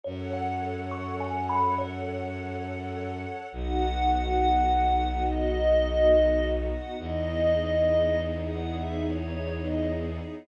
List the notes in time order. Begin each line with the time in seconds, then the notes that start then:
0.04 F#2 A4 C#5 F#5
0.33 F#5
0.91 C#6
1.20 G#5
1.49 B5
1.78 C#5
3.51 B1 B3 D#4 F#4 F#5
5.26 D#5
6.71 F#5
6.99 E2 B3 D#4 E4 G#4 D#5
8.45 F#5
8.74 E5
9.03 C#5
9.61 D#5